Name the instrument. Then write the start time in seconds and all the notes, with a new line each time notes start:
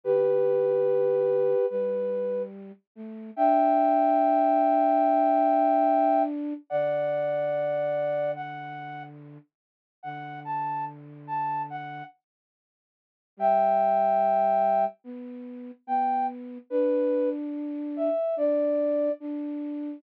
flute
0.04 D3 G4 B4
1.70 G3 B4
2.95 A3
3.36 D4 E5 G5
6.70 D3 D5 F#5
8.35 F#5
10.03 D3 F#5
10.45 A5
11.27 A5
11.70 F#5
13.37 G3 E5 G5
15.04 B3
15.87 B3 G5
16.70 D4 B4
17.96 E5
18.36 D4 D5
19.20 D4